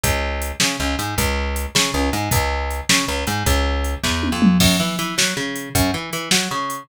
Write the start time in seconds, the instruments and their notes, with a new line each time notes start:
0.03 electric bass (finger) C#2, kick, closed hi-hat
0.42 closed hi-hat
0.60 electric bass (finger) C#3, snare
0.80 electric bass (finger) C#2
0.99 electric bass (finger) G#2, closed hi-hat
1.18 electric bass (finger) C#2, kick, closed hi-hat
1.56 closed hi-hat
1.75 electric bass (finger) C#3, snare
1.94 electric bass (finger) C#2
2.13 electric bass (finger) G#2, closed hi-hat
2.31 electric bass (finger) C#2, kick, closed hi-hat
2.71 closed hi-hat
2.89 electric bass (finger) C#3, snare
3.08 electric bass (finger) C#2
3.27 electric bass (finger) G#2, closed hi-hat
3.46 electric bass (finger) C#2, kick, closed hi-hat
3.84 closed hi-hat
4.03 electric bass (finger) E2, kick, snare
4.23 high tom
4.32 electric bass (finger) F2
4.42 mid tom
4.60 electric bass (finger) F#2, kick, crash
4.80 electric bass (finger) E3
4.99 electric bass (finger) E3, closed hi-hat
5.18 electric bass (finger) F#3, snare
5.37 electric bass (finger) C#3
5.56 closed hi-hat
5.75 electric bass (finger) F#2, kick, closed hi-hat
5.94 electric bass (finger) E3
6.13 electric bass (finger) E3, closed hi-hat
6.31 electric bass (finger) F#3, snare
6.51 electric bass (finger) C#3
6.70 closed hi-hat